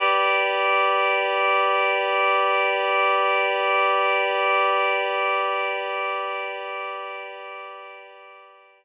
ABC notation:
X:1
M:4/4
L:1/8
Q:1/4=51
K:Glyd
V:1 name="Clarinet"
[GBd]8- | [GBd]8 |]